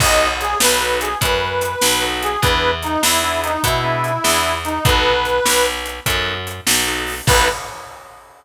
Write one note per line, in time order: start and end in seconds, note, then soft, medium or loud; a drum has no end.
0.00 0.55 B1 medium
0.00 0.28 B3 loud
0.00 0.28 D#4 loud
0.00 0.28 F#4 loud
0.00 0.28 A4 medium
0.00 0.28 D#5 medium
0.00 kick loud
0.00 crash loud
0.40 0.58 G#4 medium
0.40 closed hi-hat medium
0.60 1.15 B1 medium
0.60 0.98 B4 medium
0.60 snare loud
0.81 1.09 B3 medium
0.81 1.09 D#4 medium
0.81 1.09 F#4 medium
0.81 1.09 A4 medium
1.01 1.18 G#4 medium
1.01 closed hi-hat medium
1.21 1.76 F#2 medium
1.21 2.05 B4 medium
1.21 kick medium
1.21 closed hi-hat loud
1.61 closed hi-hat medium
1.81 2.37 B1 medium
1.81 snare loud
2.02 2.30 B3 medium
2.02 2.30 D#4 medium
2.02 2.30 F#4 medium
2.02 2.30 A4 medium
2.22 2.41 G#4 medium
2.22 closed hi-hat medium
2.42 2.97 E2 medium
2.42 2.71 B3 loud
2.42 2.71 D4 loud
2.42 2.71 E4 loud
2.42 2.71 G#4 loud
2.42 2.71 B4 medium
2.42 kick loud
2.42 closed hi-hat loud
2.82 3.02 D#4 medium
2.82 closed hi-hat medium
3.03 3.57 E2 medium
3.03 3.41 E4 medium
3.03 snare loud
3.23 3.52 B3 medium
3.23 3.52 D4 medium
3.23 3.52 E4 medium
3.23 3.52 G#4 medium
3.43 3.62 D#4 medium
3.43 closed hi-hat medium
3.63 4.18 B2 medium
3.63 4.55 E4 medium
3.63 kick medium
3.63 closed hi-hat loud
3.84 4.12 B3 medium
3.84 4.12 D4 medium
3.84 4.12 E4 medium
3.84 4.12 G#4 medium
4.04 closed hi-hat medium
4.24 4.79 E2 medium
4.24 4.52 B3 medium
4.24 4.52 D4 medium
4.24 4.52 E4 medium
4.24 4.52 G#4 loud
4.24 snare loud
4.65 4.84 D#4 medium
4.65 closed hi-hat medium
4.85 5.40 B1 medium
4.85 5.13 B3 loud
4.85 5.13 D#4 loud
4.85 5.13 F#4 loud
4.85 5.13 A4 loud
4.85 5.66 B4 medium
4.85 kick loud
4.85 closed hi-hat loud
5.25 closed hi-hat medium
5.45 6.00 B1 medium
5.45 snare loud
5.86 closed hi-hat medium
6.06 6.61 F#2 medium
6.06 6.34 B3 medium
6.06 6.34 D#4 medium
6.06 6.34 F#4 medium
6.06 6.34 A4 medium
6.06 kick medium
6.06 closed hi-hat loud
6.47 closed hi-hat medium
6.67 7.21 B1 medium
6.67 snare loud
6.87 7.15 B3 medium
6.87 7.15 D#4 loud
6.87 7.15 F#4 medium
6.87 7.15 A4 medium
7.06 open hi-hat medium
7.27 7.48 B1 loud
7.27 7.48 B3 loud
7.27 7.48 D#4 loud
7.27 7.48 F#4 loud
7.27 7.48 A4 loud
7.27 7.49 B4 loud
7.27 kick loud
7.27 crash loud